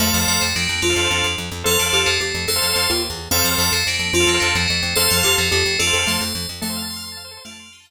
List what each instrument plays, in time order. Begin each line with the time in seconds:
0.00 electric bass (finger) F2, xylophone A3, drawbar organ A4 C5 F5, tubular bells D5 F5
0.07 drawbar organ A4 C5 F5
0.14 electric bass (finger) F2, tubular bells A#4 D5
0.21 drawbar organ A4 C5 F5
0.28 electric bass (finger) F2, tubular bells A#4 D5
0.41 electric bass (finger) F2, tubular bells A3 C4
0.56 electric bass (finger) F2, tubular bells A#3 D4
0.69 electric bass (finger) F2
0.82 electric bass (finger) F2, tubular bells D4 F4, xylophone F4
0.90 drawbar organ A4 C5 F5
0.96 electric bass (finger) F2
1.04 drawbar organ A4 C5 F5
1.11 electric bass (finger) F2
1.24 electric bass (finger) F2
1.38 electric bass (finger) F2
1.51 electric bass (finger) F2
1.64 electric bass (finger) F2, tubular bells F4 A4, drawbar organ A4 C5 F5, xylophone A4
1.71 drawbar organ A4 C5 F5
1.79 electric bass (finger) F2, tubular bells D4 F4
1.86 drawbar organ A4 C5 F5
1.93 electric bass (finger) F2, tubular bells D4 F4, xylophone G4
2.06 electric bass (finger) F2, tubular bells A3 C4
2.20 electric bass (finger) F2, tubular bells A3 C4, xylophone G4
2.34 electric bass (finger) F2
2.48 electric bass (finger) F2, xylophone A4, tubular bells A4 C5
2.56 drawbar organ A4 C5 F5
2.62 electric bass (finger) F2
2.69 drawbar organ A4 C5 F5
2.76 electric bass (finger) F2
2.90 electric bass (finger) D#2, xylophone F4
3.10 electric bass (finger) E2
3.31 electric bass (finger) F2, xylophone C4, drawbar organ A4 C5 F5, tubular bells D5 F5
3.39 drawbar organ A4 C5 F5
3.44 electric bass (finger) F2, tubular bells A#4 D5
3.51 drawbar organ A4 C5 F5
3.58 electric bass (finger) F2, tubular bells A#4 D5
3.72 electric bass (finger) F2, tubular bells A3 C4
3.87 electric bass (finger) F2, tubular bells A#3 D4
3.99 electric bass (finger) F2
4.13 electric bass (finger) F2, tubular bells D4 F4, xylophone F4
4.20 drawbar organ A4 C5 F5
4.27 electric bass (finger) F2, tubular bells A#3 D4
4.34 drawbar organ A4 C5 F5
4.40 electric bass (finger) F2, tubular bells A#3 D4
4.55 electric bass (finger) F2, tubular bells A3 C4
4.68 electric bass (finger) F2, tubular bells A3 C4
4.82 electric bass (finger) F2
4.96 electric bass (finger) F2, tubular bells A4 C5, xylophone A4, drawbar organ A4 C5 F5
5.05 drawbar organ A4 C5 F5
5.10 electric bass (finger) F2, tubular bells F4 A4
5.17 drawbar organ A4 C5 F5
5.23 electric bass (finger) F2, tubular bells F4 A4, xylophone G4
5.38 electric bass (finger) F2, tubular bells A3 C4
5.51 electric bass (finger) F2, tubular bells A3 C4, xylophone G4
5.66 electric bass (finger) F2
5.79 electric bass (finger) F2, tubular bells D4 F4, xylophone A4
5.87 drawbar organ A4 C5 F5
5.93 electric bass (finger) F2, xylophone A4
5.99 drawbar organ A4 C5 F5
6.06 electric bass (finger) F2, xylophone A3, tubular bells A4 C5
6.21 electric bass (finger) F2
6.35 electric bass (finger) F2
6.49 electric bass (finger) F2
6.61 electric bass (finger) F2, xylophone A3, drawbar organ A4, tubular bells A4 C5
6.69 drawbar organ C5
6.76 drawbar organ F5
6.82 drawbar organ A5
6.90 drawbar organ C6
6.96 drawbar organ F6
7.04 drawbar organ C6
7.12 drawbar organ A5
7.17 drawbar organ F5
7.24 drawbar organ C5
7.31 drawbar organ A4
7.37 drawbar organ C5
7.44 electric bass (finger) F2, xylophone A3, tubular bells D4 F4, drawbar organ F5
7.51 drawbar organ A5
7.59 drawbar organ C6
7.66 drawbar organ F6
7.72 tubular bells D#4 G4, drawbar organ C6
7.80 drawbar organ A5
7.85 tubular bells G4 A#4, drawbar organ F5